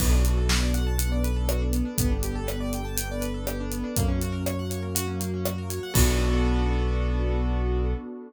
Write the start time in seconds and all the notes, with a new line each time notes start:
0.00 B1 B3 D4 F#4 A4, kick, crash
0.13 D4
0.25 F#4, closed hi-hat
0.37 A4
0.49 B4, snare
0.63 D5
0.74 F#5, closed hi-hat
0.87 A5
0.98 B3 D4 A4 B4 F#5, closed hi-hat
1.12 D5
1.24 B4, closed hi-hat
1.36 A4
1.49 F#4, cross-stick
1.62 D4
1.72 B3, closed hi-hat
1.85 D4
1.98 G1 B3 D4 G4 A4, kick, closed hi-hat
2.11 D4
2.23 G4, closed hi-hat
2.35 A4
2.47 B4, cross-stick
2.60 D5
2.73 G5, closed hi-hat
2.85 A5
2.97 B3 D4 A4 B4 G5, closed hi-hat
3.11 D5
3.21 B4, closed hi-hat
3.34 A4
3.47 G4, cross-stick
3.60 D4
3.72 B3, closed hi-hat
3.84 D4
3.96 F#2 A#3 C#4 F#4, kick, closed hi-hat
4.08 C#4
4.21 F#4, closed hi-hat
4.32 A#4
4.46 C#5, cross-stick
4.59 F#5
4.70 C#5, closed hi-hat
4.82 A#4
4.95 F#3 A#3 F#4, closed hi-hat
5.07 C#4
5.20 A#3, closed hi-hat
5.34 C#4
5.45 F#4, cross-stick
5.58 A#4
5.70 C#5, closed hi-hat
5.83 F#5
5.94 B1 B3 D4 F#4 A4, kick, crash